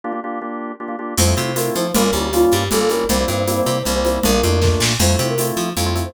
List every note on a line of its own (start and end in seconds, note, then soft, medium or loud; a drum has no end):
0.04 0.12 A#3 medium
0.04 0.12 D4 medium
0.04 0.12 F4 medium
0.04 0.12 G4 medium
0.12 0.20 A#3 medium
0.12 0.20 D4 medium
0.12 0.20 F4 medium
0.12 0.20 G4 medium
0.24 0.39 A#3 medium
0.24 0.39 D4 medium
0.24 0.39 F4 medium
0.24 0.39 G4 medium
0.41 0.72 A#3 medium
0.41 0.72 D4 medium
0.41 0.72 F4 medium
0.41 0.72 G4 medium
0.80 0.88 A#3 medium
0.80 0.88 D4 medium
0.80 0.88 F4 medium
0.80 0.88 G4 medium
0.88 0.96 A#3 medium
0.88 0.96 D4 medium
0.88 0.96 F4 medium
0.88 0.96 G4 medium
0.99 1.14 A#3 medium
0.99 1.14 D4 medium
0.99 1.14 F4 medium
0.99 1.14 G4 medium
1.18 1.34 F2 loud
1.18 1.25 A3 loud
1.18 1.25 C4 medium
1.18 1.25 E4 medium
1.18 1.25 F4 loud
1.18 1.55 C5 loud
1.18 crash medium
1.18 low conga medium
1.18 shaker medium
1.27 1.35 A3 medium
1.27 1.35 C4 medium
1.27 1.35 E4 medium
1.27 1.35 F4 medium
1.37 1.70 C3 medium
1.37 1.52 A3 medium
1.37 1.52 C4 medium
1.37 1.52 E4 medium
1.37 1.52 F4 medium
1.37 high conga medium
1.37 shaker medium
1.56 1.87 A3 medium
1.56 1.87 C4 medium
1.56 1.87 E4 medium
1.56 1.87 F4 medium
1.56 1.72 A#4 medium
1.56 tambourine medium
1.56 high conga medium
1.56 shaker medium
1.75 1.92 F3 medium
1.75 1.93 C5 loud
1.75 high conga medium
1.75 shaker medium
1.94 2.11 G1 loud
1.94 2.03 G3 loud
1.94 2.03 A#3 loud
1.94 2.03 C#4 loud
1.94 2.03 F4 loud
1.94 2.04 A#4 loud
1.94 low conga loud
1.94 shaker medium
2.03 2.11 G3 medium
2.03 2.11 A#3 medium
2.03 2.11 C#4 medium
2.03 2.11 F4 medium
2.03 2.13 A#4 loud
2.13 2.45 D2 medium
2.13 2.29 G3 medium
2.13 2.29 A#3 medium
2.13 2.29 C#4 medium
2.13 2.29 F4 medium
2.13 2.23 G4 medium
2.13 high conga medium
2.13 shaker medium
2.23 2.32 G4 loud
2.33 2.64 G3 medium
2.33 2.64 A#3 medium
2.33 2.64 C#4 medium
2.33 2.42 F4 loud
2.33 2.64 F4 medium
2.33 tambourine medium
2.33 high conga medium
2.33 shaker medium
2.42 2.51 F4 loud
2.51 2.69 G2 medium
2.51 2.71 G4 loud
2.51 high conga medium
2.51 shaker medium
2.71 3.04 G1 loud
2.71 2.79 G3 medium
2.71 2.79 A#3 loud
2.71 2.79 C#4 medium
2.71 2.79 F4 medium
2.71 2.80 A4 loud
2.71 low conga medium
2.71 shaker medium
2.80 2.88 G3 medium
2.80 2.88 A#3 medium
2.80 2.88 C#4 medium
2.80 2.88 F4 medium
2.80 2.90 A4 loud
2.89 3.05 G3 medium
2.89 3.05 A#3 medium
2.89 3.05 C#4 medium
2.89 3.05 F4 medium
2.89 3.07 A#4 loud
2.89 high conga medium
2.89 shaker medium
3.09 3.25 C2 loud
3.09 3.18 G3 loud
3.09 3.18 A#3 medium
3.09 3.18 C4 loud
3.09 3.18 E4 medium
3.09 3.18 C5 loud
3.09 low conga loud
3.09 shaker medium
3.19 3.28 G3 medium
3.19 3.28 A#3 medium
3.19 3.28 C4 medium
3.19 3.28 E4 medium
3.19 3.28 C5 loud
3.28 3.61 G2 medium
3.28 3.44 G3 medium
3.28 3.44 A#3 medium
3.28 3.44 C4 medium
3.28 3.44 E4 medium
3.28 3.37 C5 loud
3.28 high conga medium
3.28 shaker medium
3.38 3.47 C5 medium
3.47 3.78 G3 medium
3.47 3.78 A#3 loud
3.47 3.78 C4 loud
3.47 3.78 E4 medium
3.47 3.56 C5 medium
3.47 tambourine medium
3.47 high conga medium
3.47 shaker medium
3.57 3.66 C5 loud
3.66 3.83 C3 medium
3.66 3.83 C5 loud
3.66 high conga medium
3.66 shaker medium
3.85 4.19 C2 medium
3.85 3.94 G3 medium
3.85 3.94 A#3 medium
3.85 3.94 C4 medium
3.85 3.94 E4 medium
3.85 3.95 C5 medium
3.85 low conga medium
3.85 shaker medium
3.95 4.03 G3 medium
3.95 4.03 A#3 medium
3.95 4.03 C4 medium
3.95 4.03 E4 medium
3.95 4.04 C5 medium
4.04 4.20 G3 medium
4.04 4.20 A#3 medium
4.04 4.20 C4 medium
4.04 4.20 E4 medium
4.04 4.22 C5 loud
4.04 high conga medium
4.04 shaker medium
4.23 4.41 A#1 loud
4.23 4.31 A3 medium
4.23 4.31 A#3 medium
4.23 4.31 D4 medium
4.23 4.31 F4 medium
4.23 4.76 A#4 loud
4.23 low conga loud
4.23 shaker medium
4.34 4.42 A3 medium
4.34 4.42 A#3 medium
4.34 4.42 D4 medium
4.34 4.42 F4 medium
4.43 4.76 F2 loud
4.43 4.60 A3 medium
4.43 4.60 A#3 medium
4.43 4.60 D4 medium
4.43 4.60 F4 medium
4.43 high conga medium
4.43 shaker medium
4.62 4.93 A3 medium
4.62 4.93 A#3 medium
4.62 4.93 D4 medium
4.62 4.93 F4 medium
4.62 kick medium
4.62 snare medium
4.80 4.96 A#2 loud
4.80 snare loud
4.99 5.16 F2 loud
4.99 5.08 A3 medium
4.99 5.08 C4 medium
4.99 5.08 E4 medium
4.99 5.08 F4 loud
4.99 5.24 C5 loud
4.99 crash medium
4.99 low conga medium
4.99 shaker medium
5.09 5.17 A3 medium
5.09 5.17 C4 medium
5.09 5.17 E4 medium
5.09 5.17 F4 medium
5.19 5.52 C3 loud
5.19 5.34 A3 medium
5.19 5.34 C4 loud
5.19 5.34 E4 medium
5.19 5.34 F4 medium
5.19 high conga medium
5.19 shaker medium
5.29 5.47 A#4 loud
5.38 5.69 A3 medium
5.38 5.69 C4 medium
5.38 5.69 E4 medium
5.38 5.69 F4 medium
5.38 tambourine medium
5.38 high conga medium
5.38 shaker medium
5.57 5.73 F3 medium
5.57 high conga medium
5.57 shaker medium
5.77 6.09 F2 loud
5.77 5.85 A3 medium
5.77 5.85 C4 medium
5.77 5.85 E4 medium
5.77 5.85 F4 medium
5.77 low conga medium
5.77 shaker medium
5.86 5.94 A3 medium
5.86 5.94 C4 medium
5.86 5.94 E4 medium
5.86 5.94 F4 loud
5.95 6.11 A3 medium
5.95 6.11 C4 medium
5.95 6.11 E4 medium
5.95 6.11 F4 medium
5.95 high conga medium
5.95 shaker medium
6.05 6.14 C5 loud